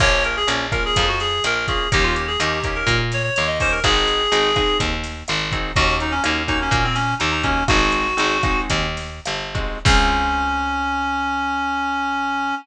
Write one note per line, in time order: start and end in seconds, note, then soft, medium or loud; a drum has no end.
0.00 0.44 A#1 medium
0.00 0.39 A#3 loud
0.00 0.39 C#4 medium
0.00 0.39 F4 loud
0.00 0.23 C#5 loud
0.00 kick medium
0.00 cross-stick medium
0.00 crash medium
0.24 0.36 A#4 medium
0.24 closed hi-hat medium
0.36 0.48 G#4 loud
0.47 0.91 A#1 medium
0.47 0.66 A#3 medium
0.47 0.66 C#4 medium
0.47 0.66 F4 medium
0.47 closed hi-hat loud
0.72 1.10 A#3 medium
0.72 1.10 C#4 medium
0.72 1.10 F4 medium
0.72 0.84 A#4 medium
0.72 kick medium
0.72 cross-stick medium
0.72 closed hi-hat medium
0.85 1.08 G#4 loud
0.96 1.40 F2 medium
0.96 kick medium
0.96 closed hi-hat loud
1.08 1.19 F#4 medium
1.20 1.43 G#4 loud
1.20 snare soft
1.20 closed hi-hat medium
1.44 1.87 A#1 medium
1.44 1.54 A#4 loud
1.44 cross-stick medium
1.44 closed hi-hat loud
1.55 1.66 A#4 medium
1.67 1.88 A#3 medium
1.67 1.88 C#4 medium
1.67 1.88 F4 medium
1.67 1.89 G#4 medium
1.67 kick medium
1.67 closed hi-hat medium
1.92 2.37 D#2 medium
1.92 2.30 A#3 medium
1.92 2.30 C#4 loud
1.92 2.30 D#4 loud
1.92 2.30 G4 medium
1.92 2.04 G4 loud
1.92 kick medium
1.92 closed hi-hat loud
2.03 2.15 F4 medium
2.15 2.26 G4 medium
2.15 closed hi-hat medium
2.27 2.39 G#4 medium
2.40 2.83 D#2 medium
2.40 2.59 A#3 medium
2.40 2.59 C#4 medium
2.40 2.59 D#4 loud
2.40 2.59 G4 medium
2.40 2.76 G4 medium
2.40 cross-stick medium
2.40 closed hi-hat loud
2.64 3.03 A#3 medium
2.64 3.03 C#4 medium
2.64 3.03 D#4 medium
2.64 3.03 G4 medium
2.64 kick medium
2.64 closed hi-hat medium
2.75 2.98 A#4 medium
2.87 3.30 A#2 medium
2.87 kick medium
2.87 closed hi-hat medium
3.12 3.23 C#5 medium
3.12 snare medium
3.12 closed hi-hat medium
3.23 3.34 C#5 medium
3.35 3.81 D#2 medium
3.35 3.46 C#5 medium
3.35 closed hi-hat medium
3.47 3.59 D#5 medium
3.60 3.79 A#3 medium
3.60 3.79 C#4 medium
3.60 3.79 D#4 medium
3.60 3.79 G4 medium
3.60 3.72 C5 loud
3.60 kick medium
3.60 open hi-hat medium
3.71 3.83 A#4 medium
3.84 4.27 G#1 medium
3.84 4.22 C4 loud
3.84 4.22 D#4 medium
3.84 4.22 F#4 loud
3.84 4.22 G#4 medium
3.84 4.77 G#4 loud
3.84 kick medium
3.84 cross-stick medium
3.84 closed hi-hat medium
4.08 closed hi-hat medium
4.32 4.75 G#1 medium
4.32 4.51 C4 medium
4.32 4.51 D#4 loud
4.32 4.51 F#4 medium
4.32 4.51 G#4 medium
4.32 closed hi-hat medium
4.56 4.95 C4 medium
4.56 4.95 D#4 medium
4.56 4.95 F#4 medium
4.56 4.95 G#4 medium
4.56 kick medium
4.56 cross-stick medium
4.56 closed hi-hat medium
4.80 5.23 D#2 medium
4.80 kick medium
4.80 closed hi-hat loud
5.04 snare soft
5.04 closed hi-hat medium
5.28 5.72 G#1 medium
5.28 cross-stick medium
5.28 closed hi-hat medium
5.52 5.71 C4 medium
5.52 5.71 D#4 medium
5.52 5.71 F#4 medium
5.52 5.71 G#4 medium
5.52 kick medium
5.52 closed hi-hat medium
5.76 6.20 D#2 medium
5.76 6.15 A#3 loud
5.76 6.15 C#4 loud
5.76 6.15 D#4 loud
5.76 5.96 F#4 loud
5.76 6.15 F#4 loud
5.76 kick medium
5.76 closed hi-hat medium
6.00 6.12 D#4 medium
6.00 closed hi-hat medium
6.11 6.23 C#4 loud
6.24 6.69 D#2 medium
6.24 6.43 A#3 medium
6.24 6.43 C#4 medium
6.24 6.43 D#4 medium
6.24 6.43 F#4 medium
6.24 cross-stick medium
6.24 closed hi-hat loud
6.48 6.86 A#3 medium
6.48 6.86 C#4 medium
6.48 6.59 D#4 loud
6.48 6.86 D#4 medium
6.48 6.86 F#4 medium
6.48 kick medium
6.48 closed hi-hat medium
6.62 6.84 C#4 medium
6.71 7.14 A#2 medium
6.71 kick medium
6.71 closed hi-hat medium
6.84 6.95 C4 medium
6.95 7.15 C#4 loud
6.95 snare medium
6.95 closed hi-hat medium
7.19 7.64 D#2 medium
7.19 7.30 D#4 medium
7.19 closed hi-hat medium
7.31 7.42 D#4 medium
7.43 7.63 A#3 medium
7.43 7.64 C#4 medium
7.43 7.63 C#4 medium
7.43 7.63 D#4 medium
7.43 7.63 F#4 medium
7.43 kick medium
7.43 closed hi-hat medium
7.68 8.14 G#1 medium
7.68 8.07 G#3 medium
7.68 8.07 C4 medium
7.68 8.07 D#4 loud
7.68 8.07 F#4 medium
7.68 8.60 F#4 loud
7.68 kick medium
7.68 cross-stick loud
7.68 closed hi-hat medium
7.92 closed hi-hat medium
8.17 8.66 G#1 medium
8.17 8.37 G#3 medium
8.17 8.37 C4 medium
8.17 8.37 D#4 medium
8.17 8.37 F#4 medium
8.17 closed hi-hat medium
8.43 8.87 G#3 medium
8.43 8.87 C4 medium
8.43 8.87 D#4 medium
8.43 8.87 F#4 medium
8.43 kick medium
8.43 cross-stick medium
8.43 closed hi-hat medium
8.70 9.20 D#2 medium
8.70 kick medium
8.70 closed hi-hat loud
8.97 snare soft
8.97 closed hi-hat medium
9.25 9.81 G1 medium
9.25 cross-stick medium
9.25 closed hi-hat medium
9.54 9.79 G#3 medium
9.54 9.79 C4 medium
9.54 9.79 D#4 medium
9.54 9.79 F#4 medium
9.54 kick medium
9.54 closed hi-hat medium
9.85 12.53 C#2 loud
9.85 12.53 C4 loud
9.85 12.53 C#4 loud
9.85 12.55 C#4 loud
9.85 12.53 F4 medium
9.85 12.53 G#4 loud
9.85 kick loud
9.85 crash loud